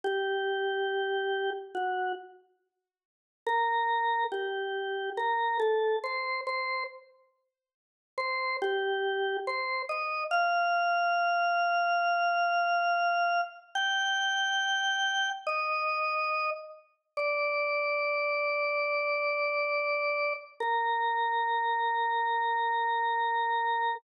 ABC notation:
X:1
M:4/4
L:1/8
Q:1/4=70
K:Gm
V:1 name="Drawbar Organ"
G4 ^F z3 | [K:Bb] B2 G2 B A c c | z3 c G2 c e | f8 |
g4 e3 z | [K:Gm] d8 | B8 |]